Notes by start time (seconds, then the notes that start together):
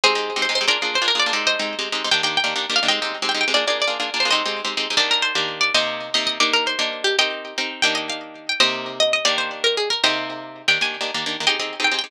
0.04 G#3 C4 D#4 G4 G#4 C5
0.15 G#3 C4 D#4 G4
0.36 G#3 C4 D#4 G4
0.42 C5
0.49 G#3 C4 D#4 G4
0.55 C5
0.61 G#3 C4 D#4 G4
0.68 A#3 D4 F4 G#4 A#4 D5
0.82 A#3 D4 F4 G#4
0.95 C5
1.02 A#3 D4 F4 G#4
1.08 A#4
1.15 A#3 D4 F4 G#4
1.19 D5
1.26 A#3 D4 F4 G#4
1.33 G#3 C4 D#4 G4
1.47 C5 D#5
1.59 G#3 C4 D#4 G4
1.79 G#3 C4 D#4 G4
1.92 G#3 C4 D#4 G4
2.04 G#3 C4 D#4 G4
2.11 D#3 A#3 D4 G4 G5
2.23 D#3 A#3 D4 G4 G5
2.37 G5
2.44 D#3 A#3 D4 G4
2.56 D#3 A#3 D4 G4
2.70 D#3 A#3 D4 G4
2.76 F5
2.83 D#3 A#3 D4 G4
2.88 G#3 C4 D#4 G4 D#5 G5
3.02 G#3 C4 D#4 G4
3.22 G#3 C4 D#4 G4
3.29 G5
3.35 G#3 C4 D#4 G4
3.41 G5
3.48 G#3 C4 D#4 G4
3.54 A#3 D4 F4 G#4 D5
3.67 A#3 D4 F4 G#4 D5
3.82 D5
3.87 A#3 D4 F4 G#4
4.00 A#3 D4 F4 G#4
4.14 A#3 D4 F4 G#4
4.20 C5
4.25 A#3 D4 F4 G#4
4.31 G#3 C4 D#4 G4 C5 D#5
4.46 G#3 C4 D#4 G4
4.65 G#3 C4 D#4 G4
4.77 G#3 C4 D#4 G4
4.90 G#3 C4 D#4 G4
4.97 D#3 A#3 D4 G4 D5
5.11 A#4
5.22 C5
5.35 D#3 A#3 D4 G4
5.61 D5
5.74 C3 A#3 D#4 G4 C5 D#5
6.14 C3 A#3 D#4 G4 D#5
6.27 D#5
6.40 A#3 D4 D#4 G4 D5
6.53 A#4
6.67 C5
6.79 A#3 D4 D#4 G4
7.04 G4
7.19 C4 D#4 G4 A#4 D#5 G5
7.58 C4 D#4 G4 A#4
7.82 D#3 A#3 D4 G4 G5
7.95 D#5
8.10 F5
8.49 G5
8.60 C3 A#3 D#4 G4 C5 D#5
9.00 D#5
9.13 D#5
9.25 D#3 A#3 D4 G4 D5
9.38 C5
9.64 A#4
9.77 G#4
9.90 A#4
10.04 C3 A#3 D#4 G4 C5 D#5
10.68 D#3 A#3 D4 G4 G5
10.81 D#3 A#3 D4 G4 G#5
11.01 D#3 A#3 D4 G4
11.14 D#3 A#3 D4 G4
11.26 D#3 A#3 D4 G4
11.40 D#3 A#3 D4 G4
11.47 C4 D#4 G4 G#4 D#5 G5
11.60 C4 D#4 G4 G#4
11.80 C4 D#4 G4 G#4
11.84 G5
11.92 C4 D#4 G4 G#4
11.99 G5
12.04 C4 D#4 G4 G#4